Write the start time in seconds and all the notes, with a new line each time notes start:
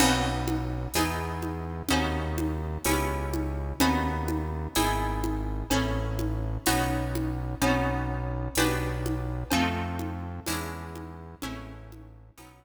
0.00 B1 B3 C#4 D#4 F#4, crash, cowbell, low conga
0.48 high conga
0.94 E2 B3 D#4 E4 G#4, tambourine, cowbell, high conga
1.42 high conga
1.89 D#2 B3 C#4 D#4 F#4, cowbell, low conga
2.38 high conga
2.85 C#2 B3 C#4 E4 G4, tambourine, cowbell, high conga
3.34 high conga
3.80 D#2 B3 C#4 D#4 F#4, cowbell, low conga
4.28 high conga
4.75 G#1 B3 D#4 E4 G#4, tambourine, cowbell, high conga
5.24 high conga
5.70 A1 C#4 E4 G#4 A4, cowbell, low conga
6.19 high conga
6.66 B1 B3 C#4 D#4 F#4, tambourine, cowbell, high conga
7.15 high conga
7.61 B1 B3 C#4 D#4 F#4, cowbell, low conga
8.55 B1 B3 D4 F#4 G4, tambourine, cowbell, high conga
9.06 high conga
9.50 F2 A3 C4 D#4 F4, cowbell, low conga
9.99 high conga
10.46 E2 G#3 C#4 D4 E4, tambourine, cowbell, high conga
10.95 high conga
11.42 A1 G#3 A3 C#4 E4, cowbell, low conga
11.92 high conga
12.37 B1 F#3 B3 C#4 D#4, tambourine, cowbell, high conga